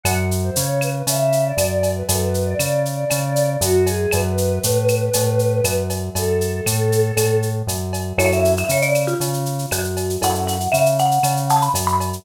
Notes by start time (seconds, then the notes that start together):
0.03 F#2 F#5, cowbell, claves, shaker
0.31 shaker
0.44 C5
0.56 C#3 C#5, shaker
0.81 B4, claves, shaker
1.07 C#3 E5, cowbell, shaker
1.32 shaker
1.45 D5
1.57 F#2 D5, cowbell, claves, shaker
1.71 D5
1.83 cowbell, shaker
1.96 B4
2.09 F#2 A4, cowbell, shaker
2.20 B4
2.34 shaker
2.45 D5
2.59 C#3, claves, shaker
2.85 D5, shaker
3.09 C#3 D5, cowbell, claves, shaker
3.24 D5
3.36 D5, shaker
3.61 F#2 F#4, cowbell, shaker
3.86 G#4, cowbell, shaker
4.11 F#2 B4, cowbell, claves, shaker
4.38 shaker
4.63 A2, shaker
4.88 claves, shaker
5.13 A2, cowbell, shaker
5.39 shaker
5.64 F#2, cowbell, claves, shaker
5.90 cowbell, shaker
6.15 F#2 A4, cowbell, shaker
6.41 shaker
6.66 A2, claves, shaker
6.92 shaker
7.17 A2, cowbell, claves, shaker
7.42 shaker
7.67 F#2, cowbell, shaker
7.93 cowbell, shaker
8.18 F#2 C#4 E4 F#4 A4 C#5, cowbell, claves, shaker
8.32 E5, shaker
8.45 shaker
8.57 E5, shaker
8.69 C#3 C#5, shaker
8.82 D5, shaker
8.94 claves, shaker
9.07 F4, shaker
9.20 C#3, cowbell, shaker
9.34 shaker
9.46 shaker
9.59 shaker
9.71 F#2 F#4, cowbell, claves, shaker
9.84 shaker
9.97 cowbell, shaker
10.10 shaker
10.22 F#2 C#4 E4 F#4 A4 F#5, cowbell, shaker
10.35 shaker
10.47 F#5, shaker
10.60 shaker
10.72 C#3 E5, claves, shaker
10.86 shaker
10.99 F#5, shaker
11.11 shaker
11.23 C#3, cowbell, claves, shaker
11.37 shaker
11.49 A5, shaker
11.62 B5, shaker
11.74 F#2, cowbell, shaker
11.87 B5, shaker
12.00 cowbell, shaker
12.13 shaker